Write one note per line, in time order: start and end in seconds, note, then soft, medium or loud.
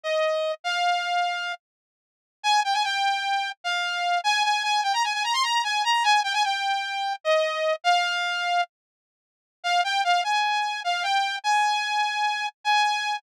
0.04 0.52 D#5 medium
0.64 1.53 F5 medium
2.43 2.60 G#5 loud
2.64 2.74 G5 medium
2.74 2.83 G#5 medium
2.84 3.50 G5 medium
3.64 4.19 F5 medium
4.24 4.43 G#5 loud
4.44 4.63 G#5 medium
4.63 4.81 G#5 medium
4.83 4.93 G5 medium
4.94 5.03 A#5 medium
5.04 5.13 G#5 medium
5.14 5.23 G#5 medium
5.24 5.33 A#5 medium
5.33 5.43 C6 medium
5.43 5.62 A#5 medium
5.64 5.83 G#5 medium
5.84 6.03 A#5 medium
6.04 6.21 G#5 loud
6.24 6.33 G5 medium
6.34 6.43 G#5 loud
6.44 7.13 G5 medium
7.24 7.74 D#5 medium
7.84 8.62 F5 loud
9.64 9.81 F5 medium
9.84 10.02 G5 medium
10.04 10.22 F5 medium
10.24 10.81 G#5 medium
10.84 11.03 F5 medium
11.03 11.36 G5 medium
11.44 12.47 G#5 medium
12.64 13.17 G#5 medium